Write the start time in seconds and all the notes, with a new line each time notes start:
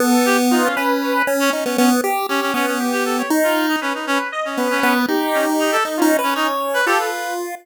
0.00 B3 A4
0.26 G4
0.51 D#4 F4
0.64 C#4
0.76 C#4 B4
1.02 C#4
1.27 C#4
1.40 C#4
1.53 C#4 D#4
1.65 B3 C#4
1.78 B3 C#4
2.04 G4
2.29 C#4 G4
2.42 C#4
2.54 B3 C#4
2.67 C#4
2.80 G4
2.92 G4
3.05 A4
3.18 C#5
3.30 D#4
3.43 F4
3.69 D#4
3.81 C#4 B4
3.94 D#4
4.07 C#4
4.32 D#5
4.45 C#4
4.57 B3 B4
4.70 C#4
4.83 B3
5.08 D#4 G4
5.34 C#4
5.59 D#4
5.72 A4
5.85 D#4
5.97 C#4 F4
6.02 D#4
6.19 B4
6.23 C#4
6.35 C#4 D#4 C#5
6.74 B4
6.86 F4 G4 A4
6.99 B4